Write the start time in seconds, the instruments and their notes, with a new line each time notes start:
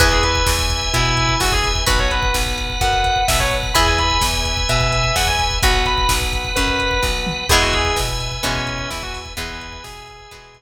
0.00 electric bass (finger) E2, acoustic guitar (steel) E4 G#4 B4, drawbar organ B4 E5 G#5, distortion guitar B4, kick, closed hi-hat
0.12 distortion guitar G#4, kick
0.23 distortion guitar B4, kick, closed hi-hat
0.35 kick
0.46 electric bass (finger) E2, kick, snare
0.59 kick
0.70 kick, closed hi-hat
0.82 kick
0.93 electric bass (finger) B2, distortion guitar E4, kick, closed hi-hat
1.05 kick
1.17 kick, closed hi-hat
1.29 kick
1.40 electric bass (finger) E2, distortion guitar F#4, kick, snare
1.52 distortion guitar G#4, kick
1.64 kick, closed hi-hat
1.75 kick
1.86 electric bass (finger) B1, acoustic guitar (steel) F#4 B4, distortion guitar B4, drawbar organ B4 F#5, kick, closed hi-hat
1.99 distortion guitar C#5, kick
2.11 distortion guitar B4, kick, closed hi-hat
2.23 kick
2.34 electric bass (finger) B1, kick, snare
2.46 kick
2.58 kick, closed hi-hat
2.70 kick
2.81 electric bass (finger) F#2, distortion guitar F#5, kick, closed hi-hat
2.93 kick
3.04 kick, closed hi-hat
3.16 kick
3.28 electric bass (finger) B1, distortion guitar E5, kick, snare
3.39 distortion guitar C#5, kick
3.51 kick, closed hi-hat
3.63 kick
3.74 electric bass (finger) E2, acoustic guitar (steel) E4 G#4 B4, drawbar organ B4 E5 G#5, distortion guitar B5, kick, closed hi-hat
3.87 distortion guitar G#5, kick
3.98 distortion guitar B5, kick, closed hi-hat
4.10 kick
4.21 electric bass (finger) E2, kick, snare
4.33 kick
4.45 kick, closed hi-hat
4.57 kick
4.69 electric bass (finger) B2, distortion guitar E5, kick, closed hi-hat
4.81 kick
4.92 kick, closed hi-hat
5.04 kick
5.16 electric bass (finger) E2, distortion guitar F#5, kick, snare
5.27 distortion guitar G#5, kick
5.39 kick, closed hi-hat
5.51 kick
5.62 electric bass (finger) B1, acoustic guitar (steel) F#4 B4, drawbar organ B4 F#5, distortion guitar F#5, kick, closed hi-hat
5.74 kick
5.86 distortion guitar B5, kick, closed hi-hat
5.98 kick
6.09 electric bass (finger) B1, kick, snare
6.21 kick
6.33 kick, closed hi-hat
6.45 kick
6.56 electric bass (finger) F#2, distortion guitar B4, kick, closed hi-hat
6.67 kick
6.79 kick, closed hi-hat
6.91 kick
7.03 electric bass (finger) B1, kick, snare
7.27 mid tom
7.49 electric bass (finger) E2, acoustic guitar (steel) E3 G#3 B3, distortion guitar G#4, drawbar organ B4 E5 G#5, kick, crash
7.62 distortion guitar F#4, kick
7.73 distortion guitar G#4, kick, closed hi-hat
7.85 kick
7.96 electric bass (finger) B2, kick, snare
8.09 kick
8.20 kick, closed hi-hat
8.32 kick
8.43 electric bass (finger) B2, acoustic guitar (steel) E3 G#3 B3, distortion guitar C#4, kick, closed hi-hat
8.55 kick
8.67 kick, closed hi-hat
8.78 kick
8.90 electric bass (finger) E2, distortion guitar E4, kick, snare
9.03 distortion guitar F#4, kick
9.14 kick, open hi-hat
9.25 kick
9.37 electric bass (finger) E2, acoustic guitar (steel) E3 G#3 B3, drawbar organ B4 E5 G#5, distortion guitar B4, kick, closed hi-hat
9.49 kick
9.61 kick, closed hi-hat
9.73 kick
9.84 electric bass (finger) B2, distortion guitar G#4, kick, snare
9.96 kick
10.08 kick, closed hi-hat
10.19 kick
10.31 electric bass (finger) B2, acoustic guitar (steel) E3 G#3 B3, kick, closed hi-hat
10.54 kick, closed hi-hat